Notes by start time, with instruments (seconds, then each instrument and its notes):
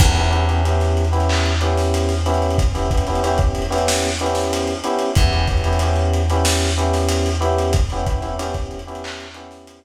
0.00 electric bass (finger) E2, electric piano 1 B3 C#4 E4 G4, kick, crash
0.15 electric piano 1 B3 C#4 E4 G4, snare, closed hi-hat
0.31 electric piano 1 B3 C#4 E4 G4, closed hi-hat
0.48 electric piano 1 B3 C#4 E4 G4, closed hi-hat
0.65 electric piano 1 B3 C#4 E4 G4, closed hi-hat
0.80 snare, closed hi-hat
0.97 closed hi-hat
1.05 closed hi-hat
1.12 electric piano 1 B3 C#4 E4 G4, closed hi-hat
1.20 closed hi-hat
1.29 clap
1.45 closed hi-hat
1.61 electric piano 1 B3 C#4 E4 G4, closed hi-hat
1.77 snare, closed hi-hat
1.94 closed hi-hat
2.09 snare, closed hi-hat
2.26 electric piano 1 B3 C#4 E4 G4, closed hi-hat
2.34 closed hi-hat
2.42 closed hi-hat
2.51 closed hi-hat
2.58 kick, closed hi-hat
2.74 electric piano 1 B3 C#4 E4 G4, closed hi-hat
2.91 electric piano 1 B3 C#4 E4 G4, kick, closed hi-hat
2.97 closed hi-hat
3.07 electric piano 1 B3 C#4 E4 G4, closed hi-hat
3.15 closed hi-hat
3.24 electric piano 1 B3 C#4 E4 G4, closed hi-hat
3.38 kick, closed hi-hat
3.55 closed hi-hat
3.62 closed hi-hat
3.70 electric piano 1 B3 C#4 E4 G4, closed hi-hat
3.78 closed hi-hat
3.88 snare
4.03 closed hi-hat
4.19 electric piano 1 B3 C#4 E4 G4, closed hi-hat
4.26 closed hi-hat
4.35 snare, closed hi-hat
4.43 closed hi-hat
4.53 closed hi-hat
4.67 closed hi-hat
4.84 electric piano 1 B3 C#4 E4 G4, closed hi-hat
4.99 closed hi-hat
5.15 electric bass (finger) E2, electric piano 1 B3 C#4 E4 G4, kick, closed hi-hat
5.32 electric piano 1 B3 C#4 E4 G4, closed hi-hat
5.47 electric piano 1 B3 C#4 E4 G4, kick, closed hi-hat
5.57 closed hi-hat
5.64 electric piano 1 B3 C#4 E4 G4, closed hi-hat
5.73 closed hi-hat
5.79 electric piano 1 B3 C#4 E4 G4, closed hi-hat
5.96 closed hi-hat
6.13 closed hi-hat
6.30 electric piano 1 B3 C#4 E4 G4, closed hi-hat
6.45 snare
6.60 closed hi-hat
6.78 electric piano 1 B3 C#4 E4 G4, closed hi-hat
6.93 snare, closed hi-hat
7.09 closed hi-hat
7.26 closed hi-hat
7.41 electric piano 1 B3 C#4 E4 G4, closed hi-hat
7.58 closed hi-hat
7.73 kick, closed hi-hat
7.90 electric piano 1 B3 C#4 E4 G4, closed hi-hat
8.06 electric piano 1 B3 C#4 E4 G4, kick, closed hi-hat
8.22 electric piano 1 B3 C#4 E4 G4, closed hi-hat
8.39 electric piano 1 B3 C#4 E4 G4, closed hi-hat
8.54 kick, closed hi-hat
8.71 closed hi-hat
8.79 closed hi-hat
8.87 electric piano 1 B3 C#4 E4 G4, closed hi-hat
8.95 closed hi-hat
9.04 clap
9.20 closed hi-hat
9.34 electric piano 1 B3 C#4 E4 G4, closed hi-hat
9.51 snare, closed hi-hat
9.67 closed hi-hat
9.83 closed hi-hat